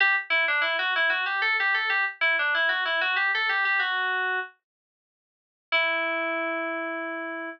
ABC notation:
X:1
M:6/8
L:1/16
Q:3/8=63
K:Em
V:1 name="Electric Piano 2"
G z E D E F E F G A G A | G z E D E F E F G A G G | F4 z8 | E12 |]